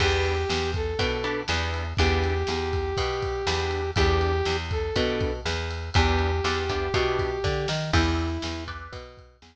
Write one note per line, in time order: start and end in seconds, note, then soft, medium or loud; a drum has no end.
0.00 0.45 E2 medium
0.00 0.35 B3 loud
0.00 0.35 D4 medium
0.00 0.35 E4 medium
0.00 0.35 G4 loud
0.00 0.71 G4 loud
0.00 kick medium
0.00 crash loud
0.25 ride medium
0.49 0.94 E2 medium
0.49 snare medium
0.74 1.40 A4 medium
0.74 kick medium
0.74 ride medium
0.99 1.43 B2 medium
0.99 1.17 B3 medium
0.99 1.17 D4 medium
0.99 1.17 E4 medium
0.99 1.17 G4 medium
0.99 kick medium
0.99 ride medium
1.24 1.41 B3 medium
1.24 1.41 D4 medium
1.24 1.41 E4 medium
1.24 1.41 G4 medium
1.24 ride medium
1.48 1.93 E2 medium
1.48 1.83 B3 medium
1.48 1.83 D4 medium
1.48 1.83 E4 medium
1.48 1.83 G4 medium
1.48 snare medium
1.74 ride medium
1.97 2.44 E2 medium
1.97 2.33 B3 medium
1.97 2.33 D4 loud
1.97 2.33 E4 medium
1.97 3.91 G4 loud
1.97 2.33 G4 loud
1.97 kick medium
1.97 ride medium
2.23 ride medium
2.47 2.93 E2 medium
2.47 snare medium
2.73 kick medium
2.73 ride medium
2.97 3.42 B2 medium
2.97 kick medium
2.97 ride medium
3.22 kick medium
3.22 ride medium
3.47 3.91 E2 medium
3.47 3.82 B3 medium
3.47 3.82 D4 medium
3.47 3.82 E4 medium
3.47 3.82 G4 medium
3.47 snare loud
3.71 ride medium
3.96 4.42 E2 medium
3.96 4.31 B3 loud
3.96 4.31 D4 loud
3.96 4.31 E4 loud
3.96 4.57 G4 loud
3.96 4.31 G4 loud
3.96 kick medium
3.96 ride medium
4.21 ride medium
4.45 4.91 E2 medium
4.45 snare medium
4.71 5.33 A4 medium
4.71 kick medium
4.71 ride medium
4.96 5.41 B2 medium
4.96 5.31 B3 medium
4.96 5.31 D4 medium
4.96 5.31 E4 medium
4.96 5.31 G4 medium
4.96 kick medium
4.96 ride medium
5.20 kick medium
5.20 ride medium
5.45 5.90 E2 medium
5.45 snare medium
5.71 ride medium
5.94 6.40 E2 loud
5.94 6.30 B3 loud
5.94 6.30 D4 medium
5.94 6.30 E4 medium
5.94 7.69 G4 loud
5.94 6.30 G4 medium
5.94 kick medium
5.94 ride medium
6.19 ride medium
6.44 6.89 E2 medium
6.44 6.62 B3 medium
6.44 6.62 D4 medium
6.44 6.62 E4 medium
6.44 6.62 G4 medium
6.44 snare medium
6.69 6.87 B3 medium
6.69 6.87 D4 medium
6.69 6.87 E4 medium
6.69 6.87 G4 medium
6.69 kick medium
6.69 ride medium
6.94 7.39 B2 medium
6.94 7.29 B3 medium
6.94 7.29 D4 medium
6.94 7.29 E4 medium
6.94 7.29 G4 medium
6.94 kick medium
6.94 ride medium
7.19 kick medium
7.19 ride medium
7.44 7.66 D3 medium
7.44 kick medium
7.44 snare medium
7.68 7.91 D#3 medium
7.68 snare medium
7.93 8.38 E2 medium
7.93 8.64 E4 loud
7.93 8.28 B4 medium
7.93 8.28 D5 medium
7.93 8.28 E5 loud
7.93 8.28 G5 loud
7.93 kick medium
7.93 crash medium
8.19 ride medium
8.42 8.88 E2 medium
8.42 snare loud
8.68 9.02 B4 medium
8.68 9.02 D5 medium
8.68 9.02 E5 medium
8.68 9.02 G5 medium
8.68 kick medium
8.68 ride medium
8.92 9.37 B2 medium
8.92 kick medium
8.92 ride medium
9.17 kick medium
9.17 ride medium
9.42 9.56 E2 medium
9.42 snare loud